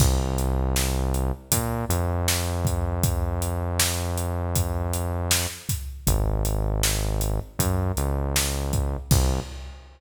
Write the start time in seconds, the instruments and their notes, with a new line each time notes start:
0.00 synth bass 1 C2, kick, crash
0.38 closed hi-hat
0.76 snare
1.14 closed hi-hat
1.52 synth bass 1 A#2, kick, closed hi-hat
1.89 synth bass 1 F2, closed hi-hat
2.28 snare
2.65 kick, closed hi-hat
3.03 kick, closed hi-hat
3.42 closed hi-hat
3.80 snare
4.18 closed hi-hat
4.56 kick, closed hi-hat
4.94 closed hi-hat
5.31 snare
5.69 kick, snare, closed hi-hat
6.07 synth bass 1 G#1, kick, closed hi-hat
6.45 closed hi-hat
6.83 snare
7.21 closed hi-hat
7.59 synth bass 1 F#2, kick, closed hi-hat
7.97 synth bass 1 C#2, closed hi-hat
8.36 snare
8.73 kick, closed hi-hat
9.11 synth bass 1 C2, kick, crash